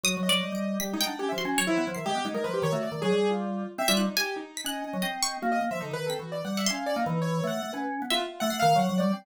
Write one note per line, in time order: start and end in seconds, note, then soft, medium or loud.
0.04 0.15 F#3 medium
0.04 0.21 F#4 medium
0.04 0.28 D#6 loud
0.17 0.29 F#3 medium
0.23 0.75 D#5 medium
0.29 0.41 F#3 medium
0.29 0.52 D5 loud
0.43 0.51 G3 medium
0.52 0.78 G3 medium
0.52 0.78 D7 medium
0.80 0.93 G3 medium
0.80 0.92 G4 soft
0.80 0.97 B6 loud
0.93 1.05 G#3 medium
0.93 1.05 D#4 medium
1.01 1.35 G5 loud
1.06 1.18 D4 medium
1.06 1.18 F#5 medium
1.19 1.31 C#4 medium
1.19 1.28 G4 medium
1.29 1.44 F3 medium
1.29 1.37 E5 medium
1.38 1.64 F#4 medium
1.38 1.55 C6 medium
1.45 1.57 C#4 loud
1.58 1.67 F#3 medium
1.58 1.93 C#5 loud
1.67 1.76 F3 medium
1.67 1.84 E4 loud
1.78 1.86 B3 medium
1.87 1.96 F3 medium
1.95 2.05 D#3 medium
1.95 2.05 E5 medium
1.95 2.29 C7 medium
2.06 2.15 G#3 medium
2.06 2.23 G4 loud
2.15 2.24 B3 medium
2.25 2.34 G#3 medium
2.25 2.33 D#4 medium
2.34 2.43 G#3 medium
2.34 2.43 A#4 medium
2.44 2.62 F3 medium
2.44 2.53 B4 medium
2.54 2.62 G4 medium
2.62 2.71 D#3 loud
2.62 2.72 C#5 loud
2.72 2.90 A3 medium
2.72 2.82 F#4 medium
2.83 3.00 D5 medium
2.92 3.00 D#3 medium
3.02 3.11 F#3 medium
3.02 3.28 G#4 loud
3.12 3.64 G3 medium
3.31 3.65 F4 medium
3.78 3.87 C4 loud
3.78 3.87 E5 loud
3.88 4.06 G3 loud
3.88 3.97 F4 medium
3.88 3.97 E5 loud
3.97 4.15 D#4 medium
3.97 4.14 F#6 medium
4.17 4.34 G4 medium
4.17 4.43 G#5 loud
4.36 4.62 D#4 medium
4.57 4.66 B6 medium
4.64 4.82 C#4 medium
4.64 5.35 D#5 medium
4.64 5.01 F#6 loud
4.84 4.93 C#4 medium
4.93 5.02 F#3 medium
5.02 5.37 C4 medium
5.02 5.11 D#5 medium
5.23 5.40 C#6 loud
5.42 5.60 A#3 loud
5.42 5.51 F#4 medium
5.52 5.60 D#5 medium
5.61 5.70 A#3 medium
5.71 5.79 F3 medium
5.71 5.80 E5 medium
5.81 5.90 D3 medium
5.81 5.92 D#4 medium
5.91 6.09 D#3 medium
5.91 6.05 B4 loud
6.06 6.18 C4 medium
6.06 6.18 A4 medium
6.06 6.53 B6 medium
6.19 6.42 E3 soft
6.19 6.31 F#4 medium
6.32 6.43 D5 medium
6.45 6.68 G3 medium
6.45 6.56 F#5 medium
6.57 6.66 E5 medium
6.57 6.66 F#5 medium
6.66 6.93 C#4 medium
6.66 6.84 F5 medium
6.66 6.92 C6 loud
6.86 6.95 D5 medium
6.96 7.05 A#3 loud
6.96 7.19 D#4 medium
7.06 7.41 E3 loud
7.22 7.45 C#5 medium
7.44 7.61 A3 medium
7.44 7.70 F#5 medium
7.63 7.71 A3 medium
7.73 8.00 C#4 medium
7.73 7.82 B4 medium
8.02 8.19 B3 medium
8.10 8.20 F4 loud
8.10 8.45 E5 medium
8.21 8.38 F4 medium
8.40 8.50 A3 loud
8.40 8.57 F#5 loud
8.50 8.62 A3 medium
8.50 8.85 C7 medium
8.60 8.74 D#3 loud
8.60 8.77 F5 loud
8.75 8.87 F#3 loud
8.75 8.96 F#5 medium
8.89 9.01 F#3 loud
8.98 9.12 G3 loud
8.98 9.15 D5 medium
9.13 9.25 C4 medium